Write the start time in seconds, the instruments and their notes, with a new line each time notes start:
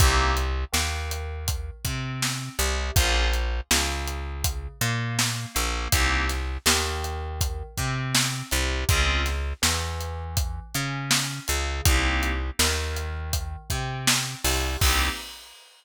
0.00 electric bass (finger) C2, electric piano 2 A#3 C4 D#4 G4, kick, closed hi-hat
0.37 closed hi-hat
0.72 electric bass (finger) D#2, electric piano 2 D#3, snare
1.11 closed hi-hat
1.48 kick, closed hi-hat
1.85 electric bass (finger) C3, electric piano 2 C4, kick, closed hi-hat
2.22 snare
2.58 electric bass (finger) C2, electric piano 2 C3, closed hi-hat
2.96 electric bass (finger) A#1, electric piano 2 A#3 C#4 F4 G#4, kick, closed hi-hat
3.33 closed hi-hat
3.71 electric bass (finger) C#2, electric piano 2 C#3, snare
4.07 closed hi-hat
4.44 kick, closed hi-hat
4.81 electric bass (finger) A#2, electric piano 2 A#3, closed hi-hat
5.19 snare
5.54 electric bass (finger) A#1, electric piano 2 A#3, closed hi-hat
5.92 electric bass (finger) C2, electric piano 2 A#3 C4 D#4 G4, kick, closed hi-hat
6.29 snare, closed hi-hat
6.66 electric bass (finger) D#2, electric piano 2 D#3, snare
7.04 closed hi-hat
7.41 kick, closed hi-hat
7.77 electric bass (finger) C3, electric piano 2 C4, kick, closed hi-hat
8.15 snare
8.51 electric bass (finger) C2, electric piano 2 C3, closed hi-hat
8.89 electric bass (finger) C#2, electric piano 2 C4 C#4 F4 G#4, kick, closed hi-hat
9.26 snare, closed hi-hat
9.62 electric bass (finger) E2, electric piano 2 E3, snare
10.00 closed hi-hat
10.37 kick, closed hi-hat
10.75 electric bass (finger) C#3, electric piano 2 C#4, closed hi-hat
11.11 snare
11.48 electric bass (finger) C#2, electric piano 2 C#3, closed hi-hat
11.85 electric bass (finger) C2, electric piano 2 A#3 C4 D#4 G4, kick, closed hi-hat
12.23 closed hi-hat
12.59 electric bass (finger) D#2, electric piano 2 D#3, snare
12.96 closed hi-hat
13.33 kick, closed hi-hat
13.70 electric bass (finger) C3, electric piano 2 C4, kick, closed hi-hat
14.07 snare
14.44 electric bass (finger) C2, electric piano 2 C3, open hi-hat
14.81 electric bass (finger) C2, electric piano 2 A#3 C4 D#4 G4, kick, crash